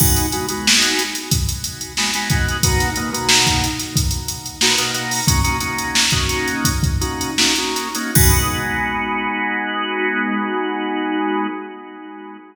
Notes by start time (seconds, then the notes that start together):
0.00 G#3 B3 D#4 F#4, kick, crash
0.16 closed hi-hat
0.32 G#3 B3 D#4 F#4, closed hi-hat
0.48 G#3 B3 D#4 F#4, closed hi-hat
0.67 snare
0.82 closed hi-hat
0.99 closed hi-hat
1.15 closed hi-hat
1.31 kick, closed hi-hat
1.49 closed hi-hat
1.64 closed hi-hat
1.81 closed hi-hat
1.97 G#3 B3 D#4 F#4, snare
2.13 G#3 B3 D#4 F#4, snare, closed hi-hat
2.30 G#3 B3 D#4 F#4, kick, closed hi-hat
2.48 closed hi-hat
2.63 B2 A#3 D#4 F#4, kick, closed hi-hat
2.80 snare, closed hi-hat
2.96 B2 A#3 D#4 F#4, closed hi-hat
3.13 B2 A#3 D#4 F#4, closed hi-hat
3.29 snare
3.47 kick, closed hi-hat
3.64 closed hi-hat
3.79 snare, closed hi-hat
3.96 kick, closed hi-hat
4.11 closed hi-hat
4.28 closed hi-hat
4.46 closed hi-hat
4.61 B2 A#3 D#4 F#4, snare
4.78 B2 A#3 D#4 F#4, closed hi-hat
4.94 B2 A#3 D#4 F#4, closed hi-hat
5.11 open hi-hat
5.27 A#3 C#4 D#4 F#4, kick, closed hi-hat
5.44 A#3 C#4 D#4 F#4, closed hi-hat
5.60 A#3 C#4 D#4 F#4, closed hi-hat
5.78 closed hi-hat
5.95 snare
6.10 A#3 C#4 D#4 F#4, kick, closed hi-hat
6.29 closed hi-hat
6.48 closed hi-hat
6.65 kick, closed hi-hat
6.83 kick, closed hi-hat
7.01 A#3 C#4 D#4 F#4, closed hi-hat
7.21 closed hi-hat
7.38 A#3 C#4 D#4 F#4, snare
7.56 A#3 C#4 D#4 F#4, closed hi-hat
7.76 closed hi-hat
7.95 A#3 C#4 D#4 F#4, closed hi-hat
8.15 G#3 B3 D#4 F#4, kick, crash